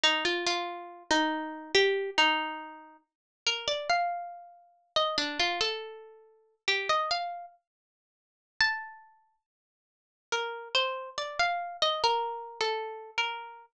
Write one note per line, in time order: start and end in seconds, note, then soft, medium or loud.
0.04 0.24 D#4 medium
0.25 0.45 F4 medium
0.46 1.03 F4 medium
1.11 1.72 D#4 medium
1.75 2.10 G4 loud
2.18 2.97 D#4 medium
3.47 3.67 A#4 medium
3.68 3.88 D5 medium
3.89 4.92 F5 medium
4.96 5.17 D#5 medium
5.18 5.38 D4 loud
5.39 5.60 F4 medium
5.61 6.55 A4 medium
6.68 6.88 G4 medium
6.89 7.10 D#5 medium
7.11 7.46 F5 medium
8.61 9.36 A5 loud
10.32 10.69 A#4 medium
10.75 11.09 C5 medium
11.18 11.38 D5 medium
11.39 11.77 F5 medium
11.82 12.03 D#5 medium
12.04 12.59 A#4 medium
12.61 13.11 A4 medium
13.18 13.66 A#4 medium